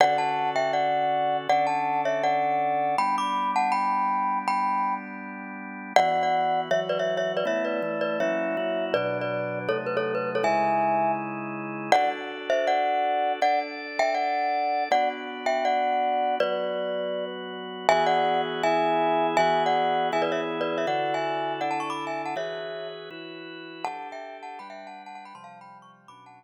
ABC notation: X:1
M:4/4
L:1/16
Q:1/4=161
K:Dmix
V:1 name="Glockenspiel"
[df]2 [fa]4 [eg]2 [df]8 | [df]2 [fa]4 [^ce]2 [df]8 | [gb]2 [bd']4 [fa]2 [gb]8 | [gb]6 z10 |
[K:Emix] [df]3 [df]5 [ce] z [Bd] [ce]2 [ce]2 [Bd] | [ce]2 [Bd]4 [Bd]2 [ce]8 | [Bd]3 [Bd]5 [Ac] z B [Ac]2 B2 [Ac] | [eg]8 z8 |
[K:Dmix] [df]2 z4 [ce]2 [df]8 | [df]2 z4 [eg]2 [df]8 | [df]2 z4 [eg]2 [df]8 | [Bd]10 z6 |
[K:Emix] [eg]2 [df]4 z2 [eg]8 | [eg]3 [df]5 [eg] [Bd] [ce] z2 [Bd]2 [ce] | [df]3 [eg]5 [df] [fa] [ac'] [bd']2 [eg]2 [fa] | [ce]6 z10 |
[K:Dmix] [fa]3 [eg]3 [fa]2 [gb] [eg]2 [fa]2 [fa] [fa] [gb] | [ac'] [=fa]2 [gb]2 ^c' z2 [bd']2 [^fa]2 z4 |]
V:2 name="Drawbar Organ"
[D,^CFA]16 | [D,^CDA]16 | [G,B,D]16- | [G,B,D]16 |
[K:Emix] [E,B,F]8 [E,F,F]8 | [A,B,E]4 [E,A,E]4 [F,^A,CE]4 [F,A,EF]4 | [B,,F,D]8 [^B,,F,A,^D]8 | [C,G,^DE]16 |
[K:Dmix] [DFA]16 | [DAd]16 | [B,DF]16 | [F,B,F]16 |
[K:Emix] [E,B,FG]8 [E,B,EG]8 | [E,B,FG]8 [E,B,EG]8 | [D,EFA]8 [D,DEA]8 | [E,FGB]8 [E,EFB]8 |
[K:Dmix] [DGA]8 [G,DB]8 | [C,=F,G,]8 [B,,^F,^CD]8 |]